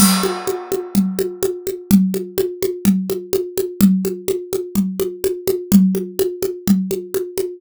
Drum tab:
CC |x-------|--------|--------|--------|
CG |OoooOooo|OoooOooo|OoooOooo|OoooOooo|